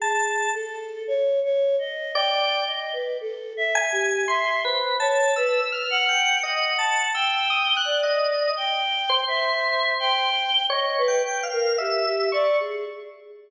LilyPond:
<<
  \new Staff \with { instrumentName = "Choir Aahs" } { \time 2/4 \tempo 4 = 56 aes'8 a'8 \tuplet 3/2 { des''8 des''8 ees''8 } | g''8 ees''16 b'16 \tuplet 3/2 { a'8 e''8 g'8 } | \tuplet 3/2 { e''8 c''8 des''8 } b'16 b'16 ges''8 | \tuplet 3/2 { ges''4 g''4 d''4 } |
\tuplet 3/2 { g''4 e''4 g''4 } | ees''16 b'16 b'16 bes'16 g'16 g'16 d''16 aes'16 | }
  \new Staff \with { instrumentName = "Drawbar Organ" } { \time 2/4 a''8 r4. | d''8 r4 aes''8 | \tuplet 3/2 { c'''8 b'8 a''8 e'''8 f'''8 g''8 } | \tuplet 3/2 { ees''8 a''8 e'''8 } ees'''16 ges'''16 ees''8 |
r8 c''4~ c''16 r16 | \tuplet 3/2 { des''8 g''8 f''8 } e''8 des'''16 r16 | }
>>